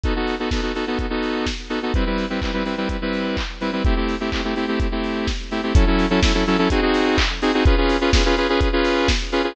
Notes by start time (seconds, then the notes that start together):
0.03 B3 D#4 F#4 A4, kick, closed hi-hat
0.16 B3 D#4 F#4 A4
0.27 open hi-hat
0.39 B3 D#4 F#4 A4
0.51 B3 D#4 F#4 A4, kick, snare
0.62 B3 D#4 F#4 A4
0.75 B3 D#4 F#4 A4, open hi-hat
0.87 B3 D#4 F#4 A4
0.99 kick, closed hi-hat
1.10 B3 D#4 F#4 A4
1.23 open hi-hat
1.46 kick, snare
1.70 B3 D#4 F#4 A4, open hi-hat
1.83 B3 D#4 F#4 A4
1.94 G3 C4 E4 B4, kick, closed hi-hat
2.06 G3 C4 E4 B4
2.18 open hi-hat
2.30 G3 C4 E4 B4
2.42 G3 C4 E4 B4, kick, clap
2.53 G3 C4 E4 B4
2.65 G3 C4 E4 B4, open hi-hat
2.77 G3 C4 E4 B4
2.89 kick, closed hi-hat
3.02 G3 C4 E4 B4
3.13 open hi-hat
3.37 kick, clap
3.61 G3 C4 E4 B4, open hi-hat
3.73 G3 C4 E4 B4
3.85 A3 C4 E4 G4, kick, closed hi-hat
3.96 A3 C4 E4 G4
4.08 open hi-hat
4.20 A3 C4 E4 G4
4.32 A3 C4 E4 G4, kick, clap
4.44 A3 C4 E4 G4
4.56 A3 C4 E4 G4, open hi-hat
4.68 A3 C4 E4 G4
4.80 kick, closed hi-hat
4.92 A3 C4 E4 G4
5.04 open hi-hat
5.27 kick, snare
5.51 A3 C4 E4 G4, open hi-hat
5.63 A3 C4 E4 G4
5.75 F#3 C#4 E4 A4, kick, closed hi-hat
5.87 F#3 C#4 E4 A4
5.99 open hi-hat
6.10 F#3 C#4 E4 A4
6.22 F#3 C#4 E4 A4, kick, snare
6.34 F#3 C#4 E4 A4
6.46 F#3 C#4 E4 A4, open hi-hat
6.58 F#3 C#4 E4 A4
6.70 C4 D#4 F#4 G#4, kick, closed hi-hat
6.82 C4 D#4 F#4 G#4
6.94 open hi-hat
7.18 kick, clap
7.42 C4 D#4 F#4 G#4, open hi-hat
7.54 C4 D#4 F#4 G#4
7.65 C#4 F4 G#4 B4, kick, closed hi-hat
7.77 C#4 F4 G#4 B4
7.89 open hi-hat
8.01 C#4 F4 G#4 B4
8.13 C#4 F4 G#4 B4, kick, snare
8.25 C#4 F4 G#4 B4
8.37 C#4 F4 G#4 B4, open hi-hat
8.49 C#4 F4 G#4 B4
8.61 kick, closed hi-hat
8.73 C#4 F4 G#4 B4
8.84 open hi-hat
9.08 kick, snare
9.32 C#4 F4 G#4 B4, open hi-hat
9.44 C#4 F4 G#4 B4